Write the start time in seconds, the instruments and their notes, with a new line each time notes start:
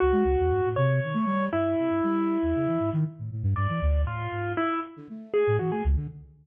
0.00 flute C#2, acoustic grand piano F#4
0.12 flute G#3
0.25 flute C#2
0.39 flute E2
0.50 flute G2
0.65 flute A2
0.76 flute C3, acoustic grand piano C#5
1.04 flute D#3
1.14 flute A3
1.26 flute G3
1.52 flute G2, acoustic grand piano E4
1.79 flute C3
1.90 flute G2
2.03 flute G3
2.42 flute E2
2.55 flute C#3
2.67 flute E3
2.80 flute G#2
2.93 flute D#3
3.19 flute A2
3.32 flute A2
3.43 flute G2
3.56 flute G2, acoustic grand piano D5
3.69 flute E3
3.82 flute D2
4.05 flute A2, acoustic grand piano F4
4.32 flute G#2
4.57 acoustic grand piano E4
4.97 flute D3
5.09 flute A3
5.34 acoustic grand piano G#4
5.47 flute A2
5.59 flute E3, acoustic grand piano F#4
5.71 flute A3, acoustic grand piano G#4
5.85 flute C#2
5.96 flute D3